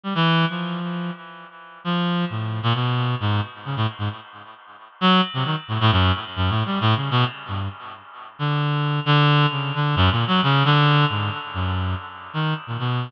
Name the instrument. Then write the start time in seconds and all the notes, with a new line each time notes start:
clarinet
0.03 G3
0.15 E3
0.50 F3
1.84 F3
2.30 A2
2.63 A#2
2.75 B2
3.20 G#2
3.65 C#3
3.76 A2
3.99 G#2
5.01 F#3
5.34 C3
5.45 D#3
5.68 A2
5.81 A2
5.92 F#2
6.36 F#2
6.50 A2
6.66 G3
6.81 A2
6.96 C#3
7.11 B2
7.48 G2
8.39 D3
9.06 D3
9.51 C#3
9.75 D3
9.96 F#2
10.11 A#2
10.27 F#3
10.43 C#3
10.65 D3
11.09 G#2
11.54 F#2
12.34 D#3
12.67 A#2
12.79 B2